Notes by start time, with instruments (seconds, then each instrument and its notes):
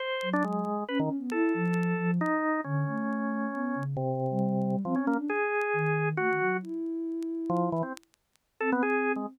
0.00 drawbar organ C5
0.22 ocarina F#3
0.33 drawbar organ D4
0.44 drawbar organ G#3
0.88 ocarina C#4, drawbar organ B4
0.99 drawbar organ D#3, ocarina C#4
1.18 ocarina B3
1.32 ocarina E4, drawbar organ A4
1.54 ocarina F3
1.99 ocarina F3
2.21 drawbar organ D#4
2.64 ocarina D3, drawbar organ C#4
2.87 ocarina A3
3.53 ocarina B3
3.75 ocarina C#3
3.97 drawbar organ C3
4.31 ocarina G3
4.85 drawbar organ F3, ocarina C4
4.95 drawbar organ C#4
5.00 ocarina C#4
5.07 drawbar organ A#3
5.15 ocarina D4
5.30 drawbar organ G#4
5.73 ocarina D#3
6.17 ocarina A3, drawbar organ F#4
6.29 ocarina D#3
6.40 ocarina F#3
6.62 ocarina E4
7.50 drawbar organ F3
7.72 drawbar organ E3
7.83 drawbar organ C4
8.60 ocarina C4, drawbar organ A4
8.72 drawbar organ B3
8.83 drawbar organ G#4
9.16 drawbar organ G#3